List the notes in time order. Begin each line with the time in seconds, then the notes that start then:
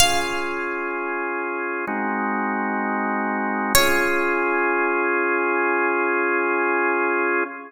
0.00 C#4 F4 G#4 F5
1.87 G#3 C4 D#4 F#4
3.75 C#4 F4 G#4 C#5